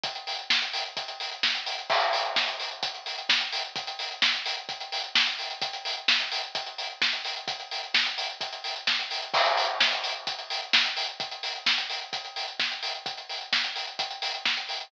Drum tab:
CC |----------------|x---------------|----------------|----------------|
HH |xxox-xoxxxox-xox|-xox-xoxxxox-xox|xxox-xoxxxox-xox|xxox-xoxxxox-xox|
SD |----o-------o---|----o-------o---|----o-------o---|----o-------o---|
BD |o---o---o---o---|o---o---o---o---|o---o---o---o---|o---o---o---o---|

CC |----------------|x---------------|----------------|----------------|
HH |xxox-xoxxxox-xox|-xox-xoxxxox-xox|xxox-xoxxxox-xox|xxox-xoxxxox-xox|
SD |----o-------o---|----o-------o---|----o-------o---|----o-------o---|
BD |o---o---o---o---|o---o---o---o---|o---o---o---o---|o---o---o---o---|